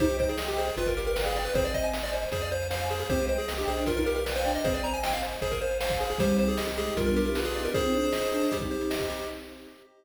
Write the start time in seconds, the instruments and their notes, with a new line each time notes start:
0.00 synth bass 1 C2, flute D#4, lead 1 (square) G4 C5, pad 2 (warm) C5 D#5 G5, kick, closed hi-hat
0.10 closed hi-hat
0.19 lead 1 (square) C5, kick, closed hi-hat
0.29 lead 1 (square) G#4, closed hi-hat
0.38 lead 1 (square) D#5, snare
0.48 lead 1 (square) G4, closed hi-hat
0.58 lead 1 (square) G#4 C5, closed hi-hat
0.68 closed hi-hat
0.77 synth bass 1 G1, lead 1 (square) F4 B4, pad 2 (warm) B4 D5 F5 G5, kick, closed hi-hat
0.86 lead 1 (square) A#4, kick, closed hi-hat
0.97 lead 1 (square) G4 A#4, closed hi-hat
1.07 lead 1 (square) A#4, closed hi-hat
1.16 lead 1 (square) B4, snare
1.25 lead 1 (square) G#4, closed hi-hat
1.36 lead 1 (square) D5, closed hi-hat
1.45 lead 1 (square) B4, closed hi-hat
1.54 synth bass 1 G#1, flute C4, lead 1 (square) G#4 C5, pad 2 (warm) C5 D#5 G#5, kick, closed hi-hat
1.65 lead 1 (square) D5, closed hi-hat
1.74 lead 1 (square) C5 D#5, kick, closed hi-hat
1.83 lead 1 (square) G#5, closed hi-hat
1.93 lead 1 (square) D#5, snare
2.02 lead 1 (square) D5, closed hi-hat
2.13 lead 1 (square) C5, closed hi-hat
2.23 closed hi-hat
2.32 synth bass 1 F2, lead 1 (square) G#4 C5, pad 2 (warm) C5 F5 G#5, kick, closed hi-hat
2.41 lead 1 (square) D5, closed hi-hat
2.51 lead 1 (square) C5, closed hi-hat
2.61 closed hi-hat
2.70 lead 1 (square) C5 F5, snare
2.82 closed hi-hat
2.90 lead 1 (square) G#4 C5, closed hi-hat
2.99 lead 1 (square) G#4, open hi-hat
3.09 synth bass 1 C2, flute C4, lead 1 (square) G4 C5, pad 2 (warm) C5 D#5 G5, kick, closed hi-hat
3.19 flute G#3, closed hi-hat
3.28 lead 1 (square) C5, closed hi-hat
3.38 lead 1 (square) G#4, closed hi-hat
3.48 flute A#3, lead 1 (square) D#5, snare
3.57 flute D4, lead 1 (square) G4, closed hi-hat
3.67 synth bass 1 B1, flute D4, lead 1 (square) G#4 C5, closed hi-hat
3.77 flute D4, closed hi-hat
3.86 lead 1 (square) F4 A#4, pad 2 (warm) B4 D5 F5 G5, kick, closed hi-hat
3.96 flute D#4, lead 1 (square) A#4, kick, closed hi-hat
4.06 lead 1 (square) G4 A#4, closed hi-hat
4.15 lead 1 (square) A#4, closed hi-hat
4.26 lead 1 (square) B4, snare
4.35 lead 1 (square) C5, closed hi-hat
4.45 flute D4, lead 1 (square) D5, closed hi-hat
4.55 lead 1 (square) D#5, closed hi-hat
4.64 synth bass 1 G#1, flute C4, lead 1 (square) G#4 C5, pad 2 (warm) C5 D#5 G#5, kick, closed hi-hat
4.74 lead 1 (square) D5, closed hi-hat
4.84 flute C4, lead 1 (square) C5 A#5, closed hi-hat
4.93 lead 1 (square) G#5, closed hi-hat
5.03 lead 1 (square) D#5 G5, snare
5.13 lead 1 (square) F5, closed hi-hat
5.23 lead 1 (square) C5, closed hi-hat
5.32 closed hi-hat
5.41 synth bass 1 G#1, lead 1 (square) G#4 C5, pad 2 (warm) C5 F5 G#5, kick, closed hi-hat
5.51 lead 1 (square) A#4, kick, closed hi-hat
5.61 lead 1 (square) C5, closed hi-hat
5.71 closed hi-hat
5.81 lead 1 (square) C5 F5, snare
5.90 kick, closed hi-hat
6.00 lead 1 (square) G#4 C5, closed hi-hat
6.10 lead 1 (square) G#4, closed hi-hat
6.18 synth bass 1 C2, flute G3, pad 2 (warm) C4 D#4 G4, lead 1 (square) G4 C5, kick, closed hi-hat
6.29 closed hi-hat
6.38 lead 1 (square) C5, closed hi-hat
6.48 lead 1 (square) G#4, closed hi-hat
6.57 lead 1 (square) D#5, snare
6.68 lead 1 (square) G4, closed hi-hat
6.77 flute G#3, lead 1 (square) G4 G#4, closed hi-hat
6.86 closed hi-hat
6.96 synth bass 1 B1, flute G3, pad 2 (warm) B3 D4 F4 G4, lead 1 (square) F4 A#4, kick, closed hi-hat
7.06 lead 1 (square) A#4, kick, closed hi-hat
7.16 lead 1 (square) G4 A#4, closed hi-hat
7.25 flute E4, lead 1 (square) A#4, closed hi-hat
7.35 flute F4, lead 1 (square) B4, snare
7.45 lead 1 (square) G#4, closed hi-hat
7.54 flute D#4, lead 1 (square) D5, closed hi-hat
7.65 flute D4, lead 1 (square) A#4, closed hi-hat
7.74 pad 2 (warm) C4 D#4 G#4, flute C4, lead 1 (square) G#4 C5, kick, closed hi-hat
7.83 flute C4, closed hi-hat
7.93 flute D4, lead 1 (square) C5, closed hi-hat
8.03 closed hi-hat
8.13 lead 1 (square) D#5, snare
8.22 closed hi-hat
8.32 flute D4, lead 1 (square) G#4, closed hi-hat
8.43 closed hi-hat
8.52 flute G3, pad 2 (warm) C4 D#4 G4, lead 1 (square) G4, kick, closed hi-hat
8.61 kick, closed hi-hat
8.71 lead 1 (square) C5, closed hi-hat
8.81 closed hi-hat
8.90 lead 1 (square) D#5, snare
9.00 kick, closed hi-hat
9.09 lead 1 (square) G4, closed hi-hat
9.19 closed hi-hat